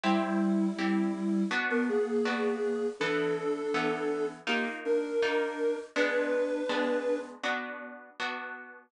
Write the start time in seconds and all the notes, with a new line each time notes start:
0.03 G3 C4 E4 G4
0.78 C4 E4 G4
1.51 B3 D4 F#4
1.70 B3 A#4
1.89 A#3 G#4
2.25 B3 D4 F#4
3.00 E3 B3 D4 A4
3.74 E3 B3 A4
4.47 A#3 D#4 F4 G4
4.85 D4 A#4
5.22 A#3 D#4 F4
5.96 G#3 B3 D4 B4
6.69 G#3 B3 D4
7.43 B3 D4 F#4
8.20 B3 D4 F#4